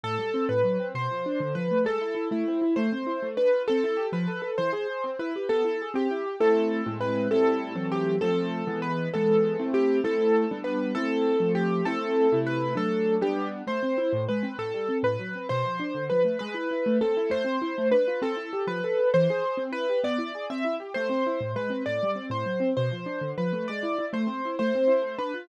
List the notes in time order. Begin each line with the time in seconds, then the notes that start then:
0.03 A2 A4
0.18 G3
0.34 C4
0.49 A2 B4
0.64 F#3
0.80 C4
0.95 B2 C5
1.11 F3
1.26 D4
1.40 D3
1.55 F3 B4
1.71 A3
1.85 G#3 A4
2.01 E4
2.15 E4
2.31 A3 E4
2.48 C4
2.62 E4
2.76 A3 C5
2.92 C4
3.07 E4
3.22 A3
3.37 D4 B4
3.53 F4
3.68 C4 A4
3.84 E4
3.97 G4
4.12 F3 B4
4.28 A4
4.42 A4
4.58 E3 C5
4.73 G#4
4.90 G#4
5.04 C4
5.19 E4 B4
5.36 G4
5.49 B3 A4
5.65 E4
5.82 G#4
5.94 C4 G4
6.11 E4
6.26 G4
6.40 A3 C4 E4 A4
6.86 A2 G#3 C4 E4
7.01 B4
7.31 A2 G3 C4 E4 A4
7.76 E3 F#3 A3 C4
7.92 G4
8.21 F3 A3 C4 A4
8.67 E3 G#3 B3
8.82 B4
9.14 E3 G#3 B3 A4
9.59 A3 C4 E4
9.74 G4
10.04 A3 C4 E4 A4
10.51 G3 B3 D4
10.64 B4
10.95 A3 C4 E4 A4
11.40 F3 A3 C4
11.55 G4
11.85 A3 C4 E4 A4
12.32 C3 A3 E4
12.47 B4
12.75 F#3 A3 D4 A4
13.21 G3 B3 D4 G4
13.67 A3 C5
13.83 C4
13.98 E4
14.13 A2
14.29 G#3 B4
14.43 C4
14.58 A2 A4
14.74 G3
14.89 C4
15.03 A2 B4
15.19 F#3
15.35 C4
15.49 B2 C5
15.65 F3
15.80 D4
15.95 D3
16.10 F3 B4
16.25 A3
16.39 G#3 B4
16.54 E4
16.71 E4
16.86 A3
17.01 C4 A4
17.17 E4
17.30 A3 C5
17.44 C4
17.62 E4
17.78 A3
17.91 D4 B4
18.08 F4
18.22 C4 A4
18.37 E4
18.53 G4
18.67 F3 B4
18.84 A4
18.99 A4
19.14 E3 C5
19.30 G#4
19.44 G#4
19.57 C4
19.72 E4 B4
19.89 G4
20.04 B3 D5
20.18 E4
20.35 G#4
20.50 C4 E5
20.65 E4
20.80 G4
20.94 A3 C5
21.09 C4
21.26 E4
21.40 A2
21.56 G#3 B4
21.70 C4
21.86 A2 D5
22.03 G3
22.15 C4
22.30 A2 C5
22.46 F#3
22.60 C4
22.77 B2 C5
22.91 F3
23.06 D4
23.21 D3
23.38 F3 B4
23.53 A3
23.68 G#3 D5
23.83 E4
23.98 E4
24.13 A3 C5
24.27 C4
24.45 E4
24.59 A3 C5
24.75 C4
24.87 E4
25.02 A3
25.18 D4 B4
25.34 F4